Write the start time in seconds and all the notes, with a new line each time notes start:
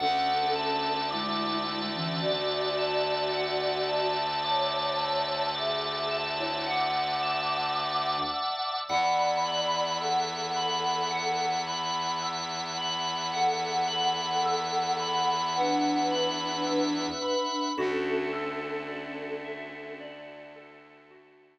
0.00 D2 C#4 A4 D5 E5 F#5 A5
0.56 A5
1.11 G#3 E4 D6
1.67 E6
1.95 E3 C#4
2.21 F#4 D5 D6
2.78 A5
3.34 F#5
3.89 A5
4.44 C#5 A5 D6
4.99 E6
5.55 G#4 E5 D6
6.11 A5
6.39 E4 C#5
6.66 F#5 D6
7.23 A5
7.78 D6
8.34 E6
8.88 E2 D5 E5 F#5 B5
9.46 B5
10.01 A4 F#5 E6
10.56 B5
11.11 F#5
11.67 B5
12.22 E6
12.77 B5
13.33 A4 F#5
13.88 A4 F#5 B5
14.46 E6
15.00 B5
15.56 D4 B4 F#5
16.11 B5
16.67 E6
17.22 B5
17.76 D2 C#4 D4 E4 F#4 A4
18.33 A4
18.88 D5
19.44 E5
20.00 D5
20.56 A4
21.11 F#4